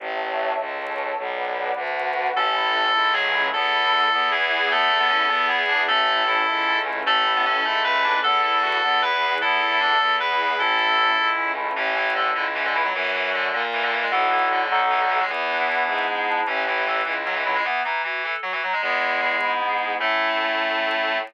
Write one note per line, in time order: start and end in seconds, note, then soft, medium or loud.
0.00 0.52 A1 medium
0.00 0.58 C#5 medium
0.00 0.58 E5 medium
0.00 0.58 A5 medium
0.59 1.12 C#2 medium
0.59 1.18 A4 medium
0.59 1.18 C#5 medium
0.59 1.18 A5 medium
1.18 1.71 B1 medium
1.18 1.76 B4 medium
1.18 1.76 D5 medium
1.18 1.76 F#5 medium
1.76 2.29 D2 medium
1.76 2.35 F#4 medium
1.76 2.35 B4 medium
1.76 2.35 F#5 medium
2.35 2.88 A1 loud
2.35 2.53 C#4 medium
2.35 2.93 C#4 medium
2.35 2.94 E4 medium
2.35 2.93 A4 medium
2.35 3.12 A4 medium
2.56 2.73 E4 medium
2.74 2.92 A4 medium
2.94 3.48 C#2 medium
2.94 3.52 A3 medium
2.94 3.52 C#4 medium
2.94 3.12 E4 medium
2.94 3.52 A4 medium
3.13 3.49 F#3 medium
3.13 3.31 C#4 medium
3.13 3.45 G#4 medium
3.33 3.51 E4 medium
3.53 4.07 E2 loud
3.53 4.11 B3 medium
3.53 3.70 B3 medium
3.53 4.11 E4 medium
3.53 4.11 A4 medium
3.53 4.28 A4 medium
3.73 3.91 E4 medium
3.92 4.10 A4 medium
4.11 4.66 E2 loud
4.11 4.29 B3 medium
4.11 4.70 B3 medium
4.11 4.70 E4 medium
4.11 4.70 G#4 medium
4.31 4.70 E3 medium
4.31 4.48 E4 medium
4.31 4.70 G#4 medium
4.51 4.69 G#4 medium
4.70 5.24 E2 loud
4.70 4.98 A3 medium
4.70 5.29 B3 medium
4.70 4.89 B3 loud
4.70 5.29 E4 medium
4.70 5.29 A4 medium
4.70 5.45 A4 medium
4.90 5.08 E4 medium
5.00 5.09 B3 medium
5.10 5.27 C#4 medium
5.10 5.28 A4 medium
5.29 5.83 E2 loud
5.29 5.61 B3 medium
5.29 5.47 B3 medium
5.29 5.88 B3 medium
5.29 5.88 E4 medium
5.29 5.88 G#4 medium
5.49 5.67 E4 medium
5.49 5.81 G#4 medium
5.69 5.85 D4 medium
5.69 5.86 G#4 medium
5.87 6.42 A1 loud
5.87 6.22 A3 loud
5.87 6.05 C#4 loud
5.87 6.46 C#4 medium
5.87 6.47 E4 medium
5.87 6.77 A4 medium
5.87 6.46 A4 medium
6.08 6.26 E4 medium
6.27 6.78 E4 medium
6.27 6.45 A4 medium
6.46 7.01 C#2 medium
6.46 7.05 A3 medium
6.46 7.05 C#4 medium
6.46 6.66 E4 medium
6.46 7.05 A4 medium
6.68 6.85 C#4 medium
6.85 7.03 E4 medium
7.05 7.58 A1 medium
7.05 7.32 A3 loud
7.05 7.64 C#4 medium
7.05 7.24 C#4 medium
7.05 7.64 E4 medium
7.05 7.64 A4 medium
7.05 7.79 A4 medium
7.25 7.42 E4 medium
7.36 7.46 B3 medium
7.45 7.64 C#4 medium
7.45 7.64 A4 medium
7.65 8.18 C#2 medium
7.65 8.03 A3 medium
7.65 8.23 A3 medium
7.65 8.23 C#4 medium
7.65 7.83 E4 medium
7.65 8.23 A4 medium
7.84 8.02 C#4 medium
7.84 8.19 B4 medium
8.03 8.21 D4 medium
8.03 8.21 E4 medium
8.23 8.78 E2 medium
8.23 8.81 B3 medium
8.23 8.41 B3 medium
8.23 8.81 E4 medium
8.23 8.81 A4 medium
8.23 9.00 A4 medium
8.23 8.42 A4 loud
8.43 8.61 E4 medium
8.43 8.62 A4 medium
8.62 8.79 F#4 medium
8.62 8.79 A4 medium
8.82 9.37 E2 medium
8.82 9.00 B3 medium
8.82 9.40 B3 medium
8.82 9.40 E4 medium
8.82 9.40 G#4 medium
9.01 9.18 E4 medium
9.01 9.35 B4 medium
9.21 9.38 G#4 medium
9.41 9.96 E2 medium
9.41 9.99 B3 medium
9.41 9.60 B3 medium
9.41 9.99 E4 medium
9.41 9.60 E4 medium
9.41 9.99 A4 medium
9.41 10.14 A4 medium
9.60 9.78 E4 medium
9.60 9.79 E4 medium
9.80 9.98 D4 medium
9.80 9.98 A4 medium
10.00 10.54 E2 medium
10.00 10.18 B3 medium
10.00 10.59 B3 medium
10.00 10.58 E4 medium
10.00 10.59 G#4 medium
10.20 10.38 E4 medium
10.20 10.57 B4 medium
10.38 10.56 G#4 medium
10.58 11.12 A1 medium
10.58 11.17 C#4 medium
10.58 10.77 C#4 medium
10.58 11.17 E4 medium
10.58 11.50 E4 medium
10.58 11.17 A4 medium
10.58 11.28 A4 medium
10.78 10.95 E4 medium
10.98 11.16 A4 medium
11.17 11.71 C#2 medium
11.17 11.77 A3 medium
11.17 11.77 C#4 medium
11.17 11.35 E4 medium
11.17 11.77 A4 medium
11.38 11.55 C#4 medium
11.56 11.74 E4 medium
11.76 12.29 A1 loud
11.76 11.95 E3 medium
11.76 11.94 C#4 loud
11.95 12.12 E3 medium
11.95 12.13 E4 medium
12.15 12.31 D3 medium
12.15 12.34 A4 loud
12.35 12.89 C#2 medium
12.35 12.44 D3 medium
12.35 12.52 E4 medium
12.55 12.64 E3 medium
12.55 12.74 C#4 medium
12.65 12.74 D3 medium
12.74 12.84 E3 medium
12.74 12.91 E4 medium
12.84 12.94 F#3 medium
12.94 13.47 F#2 loud
12.94 13.11 E3 medium
13.13 13.30 E3 medium
13.34 13.53 D3 medium
13.53 14.06 A#2 loud
13.53 13.62 D3 medium
13.73 13.82 E3 medium
13.82 13.92 D3 medium
13.92 14.02 E3 medium
14.02 14.11 G#3 medium
14.11 14.66 B1 medium
14.11 14.29 E3 medium
14.11 14.64 B3 loud
14.11 14.64 E4 loud
14.11 14.64 F#4 loud
14.11 14.64 A4 loud
14.30 14.48 E3 medium
14.51 14.70 D3 medium
14.70 15.24 B1 loud
14.70 14.80 D3 medium
14.70 15.24 B3 loud
14.70 15.24 D#4 loud
14.70 15.24 F#4 loud
14.70 15.24 A4 loud
14.90 15.00 E3 medium
15.00 15.09 D3 medium
15.09 15.19 E3 medium
15.20 15.29 G#3 medium
15.29 15.82 E2 medium
15.29 16.05 E3 medium
15.29 16.41 B3 medium
15.49 16.26 D4 medium
15.69 16.08 E4 medium
15.87 16.40 G#2 medium
15.87 16.43 G#4 medium
16.09 16.46 E4 medium
16.27 16.46 D4 medium
16.47 17.00 A1 loud
16.47 16.63 E3 medium
16.47 16.64 C#4 loud
16.67 16.84 E3 medium
16.67 16.85 E4 medium
16.86 17.03 E3 medium
16.86 17.05 A4 medium
17.05 17.60 C#2 medium
17.05 17.15 E3 medium
17.05 17.23 E4 medium
17.26 17.35 F#3 medium
17.26 17.43 C#4 medium
17.35 17.45 E3 medium
17.45 17.55 F#3 medium
17.45 17.62 E4 medium
17.55 17.64 G#3 medium
17.65 17.80 E3 medium
17.65 17.83 B3 loud
17.85 18.02 E3 medium
17.85 18.02 D#4 medium
18.04 18.23 E3 medium
18.04 18.22 F#4 medium
18.24 18.34 E3 medium
18.24 18.41 A4 medium
18.43 18.52 F#3 medium
18.43 18.61 F#4 medium
18.52 18.61 E3 medium
18.63 18.73 F#3 medium
18.63 18.81 D#4 medium
18.73 18.82 G#3 medium
18.82 19.35 E2 medium
18.82 19.51 G#3 medium
18.82 19.60 B3 medium
19.01 19.41 E4 medium
19.22 19.97 G#4 medium
19.41 19.95 G#2 medium
19.41 19.80 E4 medium
19.60 19.98 B3 medium
19.80 19.99 E4 medium
19.99 21.18 A2 loud
19.99 21.18 A3 loud
19.99 21.17 C#4 medium
19.99 21.17 E4 medium
19.99 21.17 A4 medium